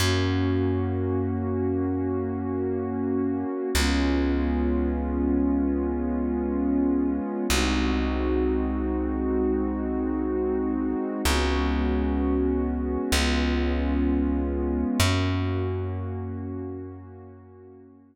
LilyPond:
<<
  \new Staff \with { instrumentName = "Pad 2 (warm)" } { \time 4/4 \key ges \lydian \tempo 4 = 64 <bes des' ges'>1 | <aes ces' des' f'>1 | <aes c' ees' ges'>1 | <aes ces' des' ges'>2 <aes ces' des' f'>2 |
<bes des' ges'>1 | }
  \new Staff \with { instrumentName = "Electric Bass (finger)" } { \clef bass \time 4/4 \key ges \lydian ges,1 | des,1 | c,1 | des,2 des,2 |
ges,1 | }
>>